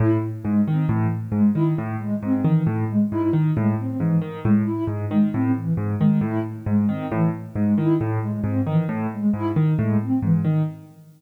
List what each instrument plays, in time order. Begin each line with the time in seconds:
0.00 acoustic grand piano A2, ocarina E4
0.43 acoustic grand piano G#2, ocarina G#3
0.67 acoustic grand piano D#3, ocarina C4
0.89 acoustic grand piano A2, ocarina E3
1.32 acoustic grand piano G#2, ocarina G#3
1.54 acoustic grand piano D#3, ocarina E4
1.78 acoustic grand piano A2
1.98 ocarina G#3
2.23 acoustic grand piano G#2, ocarina C4
2.44 acoustic grand piano D#3, ocarina E3
2.67 acoustic grand piano A2
2.89 ocarina G#3
3.11 acoustic grand piano G#2, ocarina E4
3.33 acoustic grand piano D#3
3.56 acoustic grand piano A2, ocarina G#3
3.79 ocarina C4
3.99 acoustic grand piano G#2, ocarina E3
4.22 acoustic grand piano D#3
4.45 acoustic grand piano A2, ocarina G#3
4.66 ocarina E4
4.87 acoustic grand piano G#2
5.09 acoustic grand piano D#3, ocarina G#3
5.33 acoustic grand piano A2, ocarina C4
5.55 ocarina E3
5.77 acoustic grand piano G#2
6.00 acoustic grand piano D#3, ocarina G#3
6.21 acoustic grand piano A2, ocarina E4
6.66 acoustic grand piano G#2, ocarina G#3
6.89 acoustic grand piano D#3, ocarina C4
7.12 acoustic grand piano A2, ocarina E3
7.55 acoustic grand piano G#2, ocarina G#3
7.77 acoustic grand piano D#3, ocarina E4
8.01 acoustic grand piano A2
8.21 ocarina G#3
8.44 acoustic grand piano G#2, ocarina C4
8.66 acoustic grand piano D#3, ocarina E3
8.89 acoustic grand piano A2
9.13 ocarina G#3
9.33 acoustic grand piano G#2, ocarina E4
9.56 acoustic grand piano D#3
9.79 acoustic grand piano A2, ocarina G#3
10.02 ocarina C4
10.22 acoustic grand piano G#2, ocarina E3
10.45 acoustic grand piano D#3